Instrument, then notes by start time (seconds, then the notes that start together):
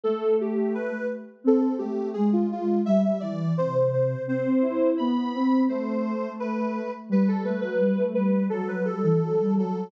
ocarina
0.04 A3 A4
0.41 G4
0.74 B4
1.44 C4 A4
1.60 A4
1.78 A3 G4
2.13 G#3 G#4
2.33 F4
2.52 F4
2.86 G3 E5
3.05 E5
3.20 E3 D5
3.57 C3 C5
3.75 C5
3.93 C5
4.27 C4 C5
4.45 C4
4.61 E4
4.98 B3 B5
5.34 C4
5.69 A3 C5
6.40 B4
7.09 G3 B4
7.28 A4
7.44 A3 B4
7.61 F#3 B4
7.79 G3
7.97 A3
8.14 G3 B4
8.50 F#3 A4
8.68 B4
8.85 G3 A4
9.03 E3 A4
9.21 F#3
9.40 G3
9.56 F#3 A4